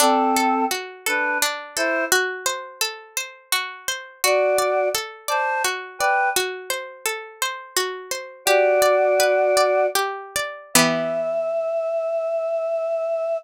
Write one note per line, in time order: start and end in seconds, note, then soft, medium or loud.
0.00 0.65 C4 loud
0.00 1.42 D4 loud
0.00 0.65 A4 loud
0.36 1.06 A4 medium
0.71 2.05 F#4 medium
1.06 1.38 D4 medium
1.06 1.76 A4 medium
1.06 1.38 B4 medium
1.42 2.09 D4 medium
1.76 2.05 E4 medium
1.76 2.10 A4 medium
1.76 2.05 C5 loud
2.12 3.52 F#4 loud
2.46 3.16 C5 medium
2.81 4.15 A4 medium
3.17 3.88 C5 medium
3.52 4.19 F#4 medium
3.88 4.22 C5 medium
4.24 4.89 F#4 medium
4.24 5.64 F#4 medium
4.24 4.89 D5 loud
4.58 5.28 D5 medium
4.95 6.29 A4 medium
5.28 5.62 C5 medium
5.28 6.00 D5 medium
5.28 5.62 A5 medium
5.64 6.31 F#4 medium
5.99 6.29 B4 medium
5.99 6.34 D5 medium
5.99 6.29 G5 loud
6.36 7.76 F#4 medium
6.70 7.41 C5 medium
7.06 8.40 A4 medium
7.42 8.11 C5 medium
7.76 8.44 F#4 medium
8.11 8.45 C5 medium
8.45 9.86 F#4 loud
8.45 9.95 G4 medium
8.45 9.86 D5 loud
8.82 9.56 D5 medium
9.20 10.67 B4 medium
9.57 10.35 D5 medium
9.95 10.71 G4 medium
10.36 10.74 D5 medium
10.74 13.38 E3 medium
10.74 13.38 B3 loud
10.74 13.38 G4 loud
10.74 13.37 E5 loud